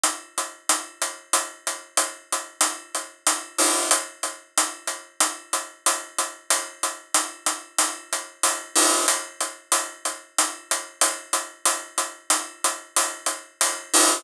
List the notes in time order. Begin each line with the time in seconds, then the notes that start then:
0.03 closed hi-hat
0.38 closed hi-hat
0.69 closed hi-hat
1.02 closed hi-hat
1.33 closed hi-hat
1.67 closed hi-hat
1.97 closed hi-hat
2.32 closed hi-hat
2.61 closed hi-hat
2.95 closed hi-hat
3.27 closed hi-hat
3.58 open hi-hat
3.91 closed hi-hat
4.23 closed hi-hat
4.58 closed hi-hat
4.87 closed hi-hat
5.20 closed hi-hat
5.53 closed hi-hat
5.86 closed hi-hat
6.18 closed hi-hat
6.50 closed hi-hat
6.83 closed hi-hat
7.14 closed hi-hat
7.46 closed hi-hat
7.78 closed hi-hat
8.13 closed hi-hat
8.43 closed hi-hat
8.76 open hi-hat
9.08 closed hi-hat
9.41 closed hi-hat
9.72 closed hi-hat
10.05 closed hi-hat
10.38 closed hi-hat
10.71 closed hi-hat
11.01 closed hi-hat
11.33 closed hi-hat
11.65 closed hi-hat
11.98 closed hi-hat
12.30 closed hi-hat
12.64 closed hi-hat
12.96 closed hi-hat
13.26 closed hi-hat
13.61 closed hi-hat
13.94 open hi-hat